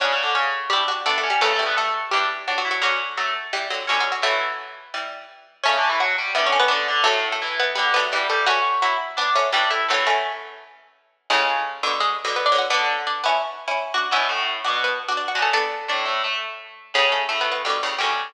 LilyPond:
<<
  \new Staff \with { instrumentName = "Harpsichord" } { \time 4/4 \key fis \phrygian \tempo 4 = 170 <cis' cis''>4 <cis' cis''>8 r8 <g g'>8 r8 \tuplet 3/2 { <a a'>8 <a a'>8 <g g'>8 } | <a a'>4 <a a'>8 r8 <g g'>8 r8 \tuplet 3/2 { <fis fis'>8 <fis fis'>8 <fis fis'>8 } | <fis fis'>4 <fis fis'>8 r8 <g g'>8 r8 \tuplet 3/2 { <fis fis'>8 <fis fis'>8 <fis fis'>8 } | <a a'>2 r2 |
<cis' cis''>4 <fis' fis''>4 \tuplet 3/2 { <e' e''>8 <cis' cis''>8 <b b'>8 } r4 | <a a'>8. <a a'>8. <b b'>4 <b b'>4 <a a'>8 | <fis' fis''>8 r8 <fis fis'>8 r4. <g g'>8 <a a'>8 | <a a'>2. r4 |
\key cis \phrygian <gis gis'>2 <gis gis'>8 r8 \tuplet 3/2 { <b b'>8 <d' d''>8 <fis' fis''>8 } | r4 <d' d''>8 <b b'>8 r2 | <b b'>2 <b b'>8 r8 \tuplet 3/2 { <d' d''>8 <fis' fis''>8 <a' a''>8 } | <a' a''>4 <d' d''>4. r4. |
\key fis \phrygian <cis' cis''>8 <a a'>8 \tuplet 3/2 { <a a'>8 <b b'>8 <b b'>8 } <g g'>4 <g g'>4 | }
  \new Staff \with { instrumentName = "Harpsichord" } { \time 4/4 \key fis \phrygian \tuplet 3/2 { <cis cis'>8 <cis cis'>8 <d d'>8 } <cis cis'>4 <d' d''>4 <d' d''>8 <cis' cis''>8 | \tuplet 3/2 { <a a'>8 <a a'>8 <b b'>8 } <a a'>4 <d' d''>4 <d' d''>8 <e' e''>8 | <cis' cis''>4 <a a'>2 <cis' cis''>4 | <e e'>2. r4 |
\tuplet 3/2 { <cis cis'>8 <d d'>8 <e e'>8 } <fis fis'>8 <g g'>8 <d d'>4 <d d'>8 <d d'>8 | <a, a>4 <e e'>4 <d d'>4 <g g'>8 <g g'>8 | <cis' cis''>4 <e' e''>4 <d' d''>4 <d' d''>8 <e' e''>8 | <e e'>2~ <e e'>8 r4. |
\key cis \phrygian <cis cis'>1 | <d d'>1 | <b, b>8 <a, a>4 <b, b>2 <cis cis'>8 | r4 <a, a>8 <a, a>8 <a a'>4. r8 |
\key fis \phrygian <cis cis'>4 <a, a>2 <cis cis'>4 | }
  \new Staff \with { instrumentName = "Harpsichord" } { \time 4/4 \key fis \phrygian <d' fis'>2 <e' g'>8 <d' fis'>8 <b d'>4 | <cis e>8 <e g>4. <e g>4. r8 | <d fis>2 <e g>8 <d fis>8 <b, d>4 | <fis a>2 <e g>4 r4 |
<a cis'>2 <g b>8 <a cis'>8 <b d'>4 | <fis a>2 <g b>8 <fis a>8 <e g>4 | <a cis'>2 <b d'>8 <a cis'>8 <e g>4 | <fis a>8 <a cis'>2~ <a cis'>8 r4 |
\key cis \phrygian <a, cis>4. <b, d>8 r8. <b, d>8. <d fis>8 | <b d'>4. <cis' e'>8 r8. <cis' e'>8. <d' fis'>8 | <cis' e'>4. <d' fis'>8 r8. <d' fis'>8. <d' fis'>8 | <b d'>4. r2 r8 |
\key fis \phrygian <a, cis>2 <b, d>8 <a, cis>8 <b, d>4 | }
>>